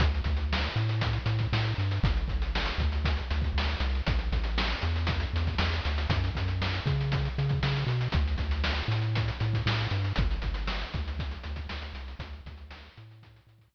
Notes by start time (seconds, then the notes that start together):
0.00 D2, kick, closed hi-hat
0.15 closed hi-hat
0.24 D2, kick, closed hi-hat
0.37 closed hi-hat
0.53 snare
0.64 closed hi-hat
0.76 A2, closed hi-hat
0.89 closed hi-hat
1.01 kick, closed hi-hat
1.13 closed hi-hat
1.26 A2, closed hi-hat
1.39 kick, closed hi-hat
1.53 A2, snare
1.64 closed hi-hat
1.78 G2, closed hi-hat
1.91 closed hi-hat
2.03 G1, kick, closed hi-hat
2.17 closed hi-hat
2.28 G1, kick, closed hi-hat
2.42 closed hi-hat
2.55 snare
2.66 closed hi-hat
2.78 D2, kick, closed hi-hat
2.92 closed hi-hat
3.05 kick, closed hi-hat
3.17 closed hi-hat
3.31 D2, closed hi-hat
3.42 kick, closed hi-hat
3.54 D2, snare
3.67 closed hi-hat
3.80 C2, closed hi-hat
3.95 closed hi-hat
4.07 A1, kick, closed hi-hat
4.19 closed hi-hat
4.32 A1, kick, closed hi-hat
4.44 closed hi-hat
4.58 snare
4.70 closed hi-hat
4.81 E2, closed hi-hat
4.96 closed hi-hat
5.07 kick, closed hi-hat
5.20 closed hi-hat
5.33 E2, closed hi-hat
5.47 kick, closed hi-hat
5.58 E2, snare
5.73 closed hi-hat
5.85 D2, closed hi-hat
5.98 closed hi-hat
6.10 F#2, kick, closed hi-hat
6.24 closed hi-hat
6.35 F#2, kick, closed hi-hat
6.48 closed hi-hat
6.62 snare
6.74 closed hi-hat
6.86 C#3, kick, closed hi-hat
7.01 closed hi-hat
7.12 kick, closed hi-hat
7.25 closed hi-hat
7.38 C#3, closed hi-hat
7.49 kick, closed hi-hat
7.63 C#3, snare
7.76 closed hi-hat
7.87 B2, closed hi-hat
8.01 closed hi-hat
8.12 D2, kick, closed hi-hat
8.28 closed hi-hat
8.38 D2, kick, closed hi-hat
8.51 closed hi-hat
8.64 snare
8.78 closed hi-hat
8.88 A2, closed hi-hat
9.02 closed hi-hat
9.15 kick, closed hi-hat
9.28 closed hi-hat
9.40 A2, closed hi-hat
9.53 kick, closed hi-hat
9.66 A2, snare
9.79 closed hi-hat
9.91 G2, closed hi-hat
10.04 closed hi-hat
10.16 G1, kick, closed hi-hat
10.31 closed hi-hat
10.42 G1, kick, closed hi-hat
10.54 closed hi-hat
10.67 snare
10.82 closed hi-hat
10.94 D2, kick, closed hi-hat
11.08 closed hi-hat
11.19 kick, closed hi-hat
11.31 closed hi-hat
11.43 D2, closed hi-hat
11.56 kick, closed hi-hat
11.69 D2, snare
11.82 closed hi-hat
11.94 C2, closed hi-hat
12.08 closed hi-hat
12.19 D2, kick, closed hi-hat
12.33 closed hi-hat
12.46 D2, kick, closed hi-hat
12.58 closed hi-hat
12.71 snare
12.83 closed hi-hat
12.97 A2, closed hi-hat
13.11 closed hi-hat
13.23 kick, closed hi-hat
13.36 closed hi-hat
13.47 A2, closed hi-hat
13.58 kick, closed hi-hat
13.73 A2, snare